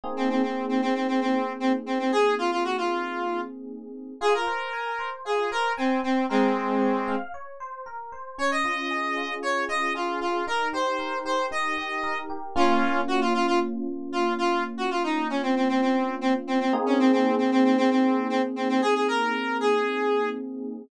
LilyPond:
<<
  \new Staff \with { instrumentName = "Lead 1 (square)" } { \time 4/4 \key bes \minor \tempo 4 = 115 r16 c'16 c'16 c'8 c'16 c'16 c'16 c'16 c'8. c'16 r16 c'16 c'16 | aes'8 f'16 f'16 ges'16 f'4~ f'16 r4. | \key f \minor aes'16 bes'4.~ bes'16 aes'8 bes'8 c'8 c'8 | <aes c'>2 r2 |
des''16 ees''4.~ ees''16 des''8 ees''8 f'8 f'8 | bes'8 c''4 c''8 ees''4. r8 | \key bes \minor <des' f'>4 ges'16 f'16 f'16 f'16 r4 f'8 f'8 | r16 ges'16 f'16 ees'8 des'16 c'16 c'16 c'16 c'8. c'16 r16 c'16 c'16 |
r16 des'16 c'16 c'8 c'16 c'16 c'16 c'16 c'8. c'16 r16 c'16 c'16 | aes'16 aes'16 bes'4 aes'4. r4 | }
  \new Staff \with { instrumentName = "Electric Piano 1" } { \time 4/4 \key bes \minor <bes c' ees' aes'>1~ | <bes c' ees' aes'>1 | \key f \minor f'8 c''8 aes''8 c''8 f'8 c''8 aes''8 c''8 | bes'8 c''8 des''8 f''8 des''8 c''8 bes'8 c''8 |
des'8 f'8 aes'8 f'8 des'8 f'8 aes'8 f'8 | ees'8 g'8 bes'8 g'8 ees'8 g'8 bes'8 g'8 | \key bes \minor <bes des' f'>1~ | <bes des' f'>1 |
<bes c' ees' aes'>1~ | <bes c' ees' aes'>1 | }
>>